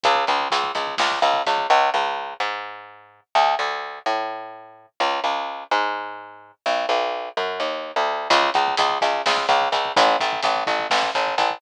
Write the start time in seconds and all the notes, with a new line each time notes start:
0.03 C#2, kick, closed hi-hat
0.15 kick
0.27 C#2, kick, closed hi-hat
0.40 kick
0.50 C#2, kick, closed hi-hat
0.64 kick
0.75 C#2, kick, closed hi-hat
0.87 kick
0.98 C#2, kick, snare
1.12 kick
1.22 C#2, kick, closed hi-hat
1.34 kick
1.46 C#2, kick, closed hi-hat
1.58 kick
1.70 C#2
1.94 C#2
2.40 G#2
3.35 D2
3.59 D2
4.06 A2
5.00 C#2
5.24 C#2
5.71 G#2
6.66 B1
6.89 B1
7.37 F#2
7.60 D#2
7.96 D2
8.30 C#2, kick, closed hi-hat
8.43 kick
8.54 C#2, kick, closed hi-hat
8.68 kick
8.77 C#2, kick, closed hi-hat
8.90 kick
9.01 C#2, kick, closed hi-hat
9.14 kick
9.26 C#2, kick, snare
9.37 kick
9.49 C#2, kick, closed hi-hat
9.62 kick
9.72 C#2, kick, closed hi-hat
9.85 kick
9.96 A1, kick, closed hi-hat
10.07 kick
10.20 A1, kick, closed hi-hat
10.33 kick
10.43 A1, kick, closed hi-hat
10.56 kick
10.67 A1, kick, closed hi-hat
10.79 kick
10.90 A1, kick, snare
11.03 kick
11.15 A1, kick, closed hi-hat
11.27 kick
11.38 A1, kick, closed hi-hat
11.50 kick